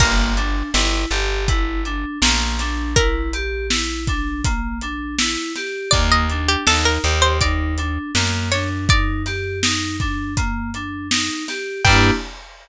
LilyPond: <<
  \new Staff \with { instrumentName = "Pizzicato Strings" } { \time 4/4 \key g \minor \tempo 4 = 81 bes'1 | bes'1 | d''16 ees''8 g'16 a'16 bes'8 c''16 d''4. cis''16 r16 | d''4. r2 r8 |
g''4 r2. | }
  \new Staff \with { instrumentName = "Electric Piano 2" } { \time 4/4 \key g \minor bes8 d'8 e'8 g'8 e'8 d'8 bes8 d'8 | e'8 g'8 e'8 d'8 bes8 d'8 e'8 g'8 | bes8 d'8 ees'8 g'8 ees'8 d'8 bes8 d'8 | ees'8 g'8 ees'8 d'8 bes8 d'8 ees'8 g'8 |
<bes d' e' g'>4 r2. | }
  \new Staff \with { instrumentName = "Electric Bass (finger)" } { \clef bass \time 4/4 \key g \minor g,,4 g,,8 g,,4. bes,,4~ | bes,,1 | ees,4 ees,8 ees,4. fis,4~ | fis,1 |
g,4 r2. | }
  \new DrumStaff \with { instrumentName = "Drums" } \drummode { \time 4/4 <cymc bd>8 hh8 sn8 hh8 <hh bd>8 hh8 sn8 <hh sn>8 | <hh bd>8 hh8 sn8 <hh bd>8 <hh bd>8 hh8 sn8 <hh sn>8 | <hh bd>8 hh8 sn8 hh8 <hh bd>8 hh8 sn8 <hh sn>8 | <hh bd>8 <hh sn>8 sn8 <hh bd>8 <hh bd>8 hh8 sn8 <hh sn>8 |
<cymc bd>4 r4 r4 r4 | }
>>